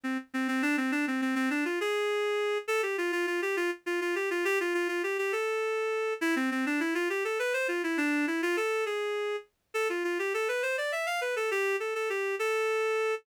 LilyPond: \new Staff { \time 6/8 \key a \minor \partial 4. \tempo 4. = 68 c'16 r16 c'16 c'16 d'16 c'16 | d'16 c'16 c'16 c'16 d'16 f'16 gis'4. | a'16 g'16 f'16 f'16 f'16 g'16 f'16 r16 f'16 f'16 g'16 f'16 | g'16 f'16 f'16 f'16 g'16 g'16 a'4. |
e'16 c'16 c'16 d'16 e'16 f'16 g'16 a'16 b'16 c''16 f'16 e'16 | d'8 e'16 f'16 a'8 gis'4 r8 | a'16 f'16 f'16 g'16 a'16 b'16 c''16 d''16 e''16 f''16 b'16 a'16 | g'8 a'16 a'16 g'8 a'4. | }